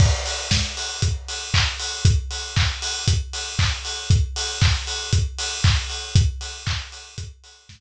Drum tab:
CC |x-------|--------|--------|--------|
HH |-o-oxo-o|xo-oxo-o|xo-oxo-o|xo-oxo--|
CP |------x-|--x---x-|--x---x-|--x-----|
SD |--o-----|--------|--------|------o-|
BD |o-o-o-o-|o-o-o-o-|o-o-o-o-|o-o-o-o-|